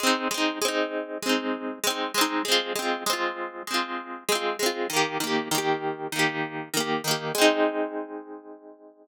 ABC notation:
X:1
M:4/4
L:1/8
Q:1/4=98
K:Ab
V:1 name="Orchestral Harp"
[A,CE] [A,CE] [A,CE]2 [A,CE]2 [A,CE] [A,CE] | [A,CF] [A,CF] [A,CF]2 [A,CF]2 [A,CF] [A,CF] | [E,B,G] [E,B,G] [E,B,G]2 [E,B,G]2 [E,B,G] [E,B,G] | [A,CE]8 |]